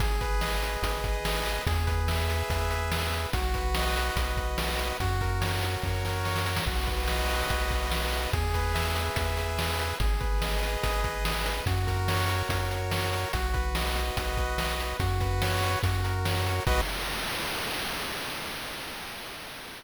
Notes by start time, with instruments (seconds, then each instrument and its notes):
0.00 synth bass 1 G#1, lead 1 (square) G#4, kick, closed hi-hat
0.21 lead 1 (square) B4, kick, closed hi-hat
0.41 lead 1 (square) D#5, snare
0.62 lead 1 (square) B4, closed hi-hat
0.82 synth bass 1 G#1, lead 1 (square) G#4, kick, closed hi-hat
1.04 lead 1 (square) B4, kick, closed hi-hat
1.25 lead 1 (square) D#5, snare
1.46 lead 1 (square) B4, closed hi-hat
1.66 synth bass 1 E2, lead 1 (square) G#4, kick, closed hi-hat
1.87 lead 1 (square) B4, kick, closed hi-hat
2.08 lead 1 (square) E5, snare
2.28 lead 1 (square) B4, closed hi-hat
2.50 synth bass 1 E2, lead 1 (square) G#4, kick, closed hi-hat
2.71 lead 1 (square) B4, closed hi-hat
2.91 lead 1 (square) E5, snare
3.12 lead 1 (square) B4, closed hi-hat
3.33 synth bass 1 B1, lead 1 (square) F#4, kick, closed hi-hat
3.54 lead 1 (square) B4, kick, closed hi-hat
3.75 lead 1 (square) D#5, snare
3.96 lead 1 (square) B4, closed hi-hat
4.16 synth bass 1 B1, lead 1 (square) F#4, kick, closed hi-hat
4.37 lead 1 (square) B4, kick, closed hi-hat
4.58 lead 1 (square) D#5, snare
4.79 lead 1 (square) B4, closed hi-hat
5.00 synth bass 1 F#2, lead 1 (square) F#4, kick, closed hi-hat
5.21 lead 1 (square) A#4, kick, closed hi-hat
5.41 lead 1 (square) C#5, snare
5.62 lead 1 (square) A#4, closed hi-hat
5.83 synth bass 1 F#2, lead 1 (square) F#4, kick, snare
6.05 lead 1 (square) A#4, snare
6.25 lead 1 (square) C#5, snare
6.36 snare
6.45 lead 1 (square) A#4, snare
6.57 snare
6.66 synth bass 1 B1, lead 1 (square) F#4, kick, crash
6.87 lead 1 (square) B4, kick, closed hi-hat
7.08 lead 1 (square) D#5, snare
7.29 lead 1 (square) B4, closed hi-hat
7.50 synth bass 1 B1, lead 1 (square) F#4, kick, closed hi-hat
7.71 lead 1 (square) B4, kick, closed hi-hat
7.91 lead 1 (square) D#5, snare
8.13 lead 1 (square) B4, closed hi-hat
8.33 synth bass 1 E2, lead 1 (square) G#4, kick, closed hi-hat
8.54 lead 1 (square) B4, kick, closed hi-hat
8.74 lead 1 (square) E5, snare
8.96 lead 1 (square) B4, closed hi-hat
9.16 synth bass 1 E2, lead 1 (square) G#4, kick, closed hi-hat
9.37 lead 1 (square) B4, closed hi-hat
9.59 lead 1 (square) E5, snare
9.79 lead 1 (square) B4, closed hi-hat
10.00 synth bass 1 G#1, lead 1 (square) G#4, kick, closed hi-hat
10.20 lead 1 (square) B4, kick, closed hi-hat
10.41 lead 1 (square) D#5, snare
10.63 lead 1 (square) B4, closed hi-hat
10.83 synth bass 1 G#1, lead 1 (square) G#4, kick, closed hi-hat
11.04 lead 1 (square) B4, kick, closed hi-hat
11.25 lead 1 (square) D#5, snare
11.45 lead 1 (square) B4, closed hi-hat
11.66 synth bass 1 F#2, lead 1 (square) F#4, kick, closed hi-hat
11.87 lead 1 (square) A#4, kick, closed hi-hat
12.08 lead 1 (square) C#5, snare
12.29 lead 1 (square) A#4, closed hi-hat
12.49 synth bass 1 F#2, lead 1 (square) F#4, kick, closed hi-hat
12.71 lead 1 (square) A#4, closed hi-hat
12.91 lead 1 (square) C#5, snare
13.13 lead 1 (square) A#4, closed hi-hat
13.33 synth bass 1 B1, lead 1 (square) F#4, kick, closed hi-hat
13.54 lead 1 (square) B4, kick, closed hi-hat
13.75 lead 1 (square) D#5, snare
13.96 lead 1 (square) B4, closed hi-hat
14.17 synth bass 1 B1, lead 1 (square) F#4, kick, closed hi-hat
14.37 lead 1 (square) B4, kick, closed hi-hat
14.58 lead 1 (square) D#5, snare
14.79 lead 1 (square) B4, closed hi-hat
15.00 synth bass 1 F#2, lead 1 (square) F#4, kick, closed hi-hat
15.20 lead 1 (square) B4, kick, closed hi-hat
15.42 lead 1 (square) C#5, snare
15.62 lead 1 (square) B4, closed hi-hat
15.83 synth bass 1 F#2, lead 1 (square) F#4, kick, closed hi-hat
16.04 lead 1 (square) A#4, closed hi-hat
16.25 lead 1 (square) C#5, snare
16.45 lead 1 (square) A#4, closed hi-hat
16.67 synth bass 1 B1, lead 1 (square) F#4 B4 D#5, kick, crash